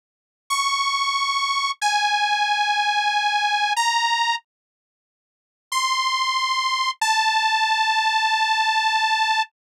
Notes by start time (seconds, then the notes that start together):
0.50 C#6
1.81 G#5
3.76 A#5
5.72 C6
7.01 A5